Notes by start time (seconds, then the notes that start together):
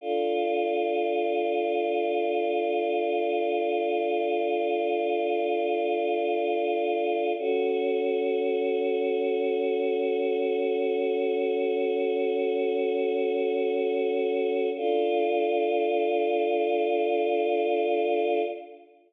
0.01 D4 F4 A4
7.38 C#4 F#4 A4
14.77 D4 F4 A4